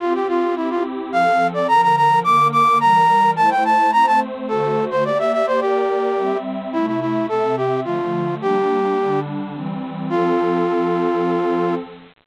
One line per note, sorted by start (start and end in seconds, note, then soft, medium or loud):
0.00 0.55 C4 medium
0.00 0.55 F4 medium
0.00 0.13 F4 medium
0.00 0.55 G4 medium
0.14 0.27 G4 medium
0.28 0.55 F4 medium
0.56 1.11 C4 medium
0.56 0.69 E4 medium
0.56 1.12 E4 medium
0.56 1.12 G4 medium
0.70 0.83 F4 medium
1.12 1.67 F3 medium
1.12 1.67 C4 medium
1.12 1.67 A4 medium
1.12 1.47 F5 medium
1.54 1.67 D5 medium
1.68 2.23 D3 medium
1.68 2.23 F3 medium
1.68 2.23 A#4 medium
1.68 1.81 A#5 medium
1.82 1.96 A#5 medium
1.96 2.19 A#5 medium
2.24 2.80 D3 medium
2.24 2.80 A#3 medium
2.24 2.80 A#4 medium
2.24 2.48 D6 medium
2.52 2.78 D6 medium
2.80 3.36 E3 medium
2.80 3.36 G3 medium
2.80 3.36 A#4 medium
2.80 3.31 A#5 medium
3.36 3.91 A3 medium
3.36 3.92 E4 medium
3.36 3.91 C5 medium
3.36 3.50 A5 medium
3.50 3.64 G5 medium
3.65 3.91 A5 medium
3.92 4.48 A3 medium
3.92 4.48 C4 medium
3.92 4.48 C5 medium
3.92 4.06 A#5 medium
4.07 4.20 A5 medium
4.48 5.04 D3 medium
4.48 5.04 A3 loud
4.48 5.04 F#4 medium
4.48 4.85 A4 medium
4.48 5.04 C5 medium
4.91 5.04 C5 medium
5.05 5.60 A#3 medium
5.05 5.60 G4 medium
5.05 5.60 D5 medium
5.05 5.18 D5 medium
5.19 5.32 E5 medium
5.33 5.46 E5 medium
5.47 5.60 C5 medium
5.60 6.16 A#3 medium
5.60 6.38 G4 medium
5.60 6.16 A#4 medium
5.60 6.16 D5 medium
6.17 6.73 G3 medium
6.17 6.73 C4 medium
6.17 6.72 E5 medium
6.73 7.29 C3 medium
6.73 7.29 A3 loud
6.73 6.86 E4 loud
6.73 7.29 E5 medium
6.87 7.00 E4 medium
7.01 7.26 E4 medium
7.29 7.85 C3 medium
7.29 7.85 C4 medium
7.29 7.56 A4 medium
7.29 7.85 E5 medium
7.57 7.80 G4 medium
7.84 8.40 D3 medium
7.84 8.40 F3 medium
7.84 8.40 A3 medium
7.84 8.35 F4 medium
8.41 8.96 G3 medium
8.41 8.97 A#3 medium
8.41 8.96 D4 medium
8.41 9.20 G4 loud
8.97 9.52 D3 medium
8.97 9.52 G3 medium
8.97 9.52 D4 loud
9.54 10.09 E3 medium
9.54 10.09 G3 medium
9.54 10.09 C4 medium
10.09 11.75 F3 medium
10.09 11.75 C4 loud
10.09 11.75 F4 loud
10.09 11.75 A4 loud